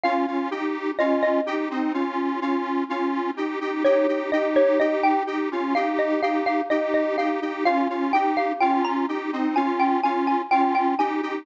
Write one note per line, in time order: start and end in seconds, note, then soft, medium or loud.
0.04 0.26 C#4 loud
0.04 0.26 F4 loud
0.04 0.90 F5 loud
0.27 0.50 C#4 medium
0.27 0.50 F4 medium
0.51 0.91 D#4 medium
0.51 0.91 G4 medium
0.99 1.41 C#4 medium
0.99 1.41 F4 medium
0.99 1.21 D#5 loud
1.23 2.76 D#5 loud
1.46 1.69 D#4 medium
1.46 1.69 G4 medium
1.70 1.93 C4 medium
1.70 1.93 D#4 medium
1.94 2.40 C#4 medium
1.94 2.40 F4 medium
2.41 2.84 C#4 medium
2.41 2.84 F4 medium
2.89 3.31 C#4 medium
2.89 3.31 F4 medium
3.37 3.59 D#4 medium
3.37 3.59 G4 medium
3.61 3.83 D#4 medium
3.61 3.83 G4 medium
3.84 4.07 D#4 medium
3.84 4.07 G4 loud
3.84 4.29 C#5 loud
4.08 4.31 D#4 medium
4.08 4.31 G4 medium
4.32 4.79 D#4 medium
4.32 4.79 G4 medium
4.32 4.55 D#5 medium
4.56 4.79 C#5 loud
4.80 5.23 D#4 medium
4.80 5.23 G4 medium
4.80 5.02 D#5 loud
5.03 5.26 G5 loud
5.27 5.49 D#4 medium
5.27 5.49 G4 medium
5.51 5.74 C#4 medium
5.51 5.74 F4 medium
5.75 6.21 D#4 medium
5.75 6.21 G4 medium
5.75 5.98 F5 loud
5.99 6.21 D#5 medium
6.22 6.61 D#4 medium
6.22 6.61 G4 medium
6.22 6.45 F5 medium
6.46 6.69 F5 loud
6.70 7.16 D#4 medium
6.70 7.16 G4 medium
6.70 6.93 D#5 medium
6.94 7.17 D#5 medium
7.18 7.40 D#4 medium
7.18 7.40 G4 medium
7.18 7.64 F5 medium
7.42 7.64 D#4 medium
7.42 7.64 G4 medium
7.65 7.88 C#4 loud
7.65 7.88 F4 loud
7.65 8.04 F5 loud
7.89 8.12 C#4 medium
7.89 8.12 F4 medium
8.13 8.53 D#4 medium
8.13 8.53 G4 medium
8.13 8.36 G5 loud
8.37 8.60 F5 loud
8.61 9.06 C#4 medium
8.61 9.06 F4 medium
8.61 8.83 G5 loud
8.85 9.07 A#5 medium
9.08 9.31 D#4 medium
9.08 9.31 G4 medium
9.33 9.55 C4 medium
9.33 9.55 D#4 medium
9.56 10.01 C#4 medium
9.56 10.01 F4 loud
9.56 9.78 G#5 medium
9.80 10.02 G5 medium
10.04 10.42 C#4 medium
10.04 10.42 F4 medium
10.04 10.26 G#5 medium
10.27 10.50 G#5 medium
10.51 10.95 C#4 medium
10.51 10.95 F4 medium
10.51 10.74 G5 loud
10.75 10.98 G5 medium
10.99 11.21 D#4 medium
10.99 11.21 G4 loud
10.99 11.39 G#5 medium
11.22 11.45 D#4 medium
11.22 11.45 G4 loud